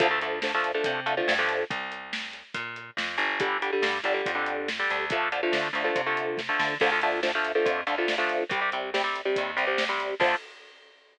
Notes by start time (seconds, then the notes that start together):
0.00 D2 D3 F3 A3, kick, closed hi-hat
0.11 D3 F3 A3
0.21 D3 F3 A3, closed hi-hat
0.42 D3 F3 A3, snare
0.54 D3 F3 A3
0.64 closed hi-hat
0.74 D3 F3 A3
0.84 C3, kick, closed hi-hat
1.06 D3 F3 A3, closed hi-hat
1.17 D3 F3 A3
1.28 G2, snare
1.39 D3 F3 A3
1.49 closed hi-hat
1.70 C2, kick, closed hi-hat
1.92 closed hi-hat
2.13 snare
2.33 closed hi-hat
2.54 A#2, kick, closed hi-hat
2.76 closed hi-hat
2.97 F2, snare
3.18 G1, closed hi-hat
3.40 D3 G3, kick, closed hi-hat
3.62 D3 G3, closed hi-hat
3.73 D3 G3
3.82 G2, snare
4.04 G1 D3 G3, closed hi-hat
4.14 D3 G3
4.26 F2, kick, closed hi-hat
4.35 D3 G3
4.46 closed hi-hat
4.68 snare
4.79 D3 G3
4.90 D2, closed hi-hat
5.10 D3 F3 A3, kick, closed hi-hat
5.32 D3 F3 A3, closed hi-hat
5.43 D3 F3 A3
5.52 D3, snare
5.73 D2 D3 F3 A3, closed hi-hat
5.84 D3 F3 A3
5.95 C3, kick, closed hi-hat
6.06 D3 F3 A3
6.17 closed hi-hat
6.38 kick, snare
6.49 D3 F3 A3
6.59 D3, snare
6.80 D2 D3 F3 A3, kick, crash
6.92 D3 F3 A3
7.02 D3 F3 A3, closed hi-hat
7.23 D3 F3 A3, snare
7.35 D3 F3 A3
7.45 closed hi-hat
7.55 D3 F3 A3
7.65 F2, kick, closed hi-hat
7.87 D2 D3 F3 A3, closed hi-hat
7.98 D3 F3 A3
8.08 snare
8.18 D3 F3 A3
8.29 closed hi-hat
8.49 C2 C3 G3, kick, closed hi-hat
8.61 C3 G3
8.72 C3 G3, closed hi-hat
8.94 C3 G3, snare
9.04 C3 G3
9.16 closed hi-hat
9.25 C3 G3
9.36 D#2, kick, closed hi-hat
9.57 C2 C3 G3, closed hi-hat
9.67 C3 G3
9.78 snare
9.89 C3 G3
10.00 closed hi-hat
10.20 D2 D3 F3 A3, kick, crash